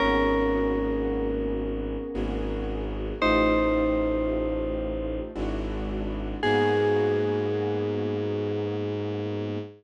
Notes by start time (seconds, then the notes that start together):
0.00 G#1 A#3 B3 C#4 F#4 G#4 A#4
2.14 G#1 A#3 B3 F#4 G#4
3.21 A1 A3 D#4 F4 G4 C5
5.35 G#1 G#3 D4 E4 F#4
6.43 G#2 A#3 B3 F#4 G#4